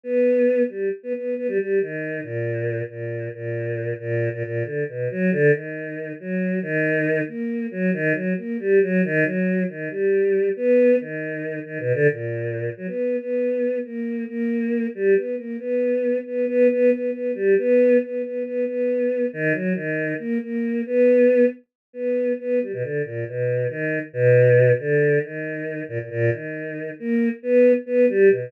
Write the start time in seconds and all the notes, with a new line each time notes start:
0.04 B3
0.69 G3
1.03 B3
1.15 B3
1.37 B3
1.48 G3
1.59 G3
1.81 D#3
2.23 A#2
2.89 A#2
3.34 A#2
4.00 A#2
4.33 A#2
4.44 A#2
4.64 D3
4.89 B2
5.11 F#3
5.32 D3
5.53 D#3
6.20 F#3
6.62 D#3
7.27 A#3
7.71 F#3
7.93 D#3
8.14 F#3
8.37 A#3
8.60 G3
8.82 F#3
9.04 D#3
9.24 F#3
9.69 D#3
9.90 G3
10.56 B3
11.00 D#3
11.65 D#3
11.79 B2
11.94 D3
12.11 A#2
12.77 F#3
12.87 B3
13.20 B3
13.85 A#3
14.28 A#3
14.95 G3
15.16 B3
15.37 A#3
15.59 B3
16.26 B3
16.48 B3
16.71 B3
16.91 B3
17.12 B3
17.35 G3
17.58 B3
18.02 B3
18.23 B3
18.45 B3
18.67 B3
19.33 D#3
19.53 F#3
19.75 D#3
20.19 A#3
20.42 A#3
20.86 B3
21.93 B3
22.40 B3
22.62 G3
22.73 B2
22.82 D3
23.05 A#2
23.28 B2
23.70 D#3
24.13 B2
24.79 D3
25.24 D#3
25.89 A#2
25.99 A#2
26.11 A#2
26.31 D#3
26.99 A#3
27.43 B3
27.86 B3
28.09 G3
28.30 B2